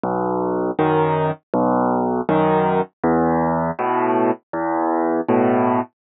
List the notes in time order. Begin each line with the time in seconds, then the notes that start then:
0.04 B1
0.79 F#2 D#3
1.54 B1
2.29 F#2 D#3
3.04 E2
3.79 A2 B2
4.53 E2
5.29 A2 B2